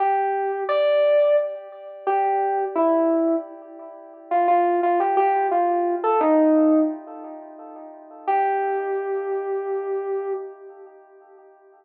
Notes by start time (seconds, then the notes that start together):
0.00 G4
0.69 D5
2.07 G4
2.75 E4
4.31 F4
4.48 F4
4.83 F4
5.00 G4
5.17 G4
5.51 F4
6.04 A4
6.21 D#4
8.27 G4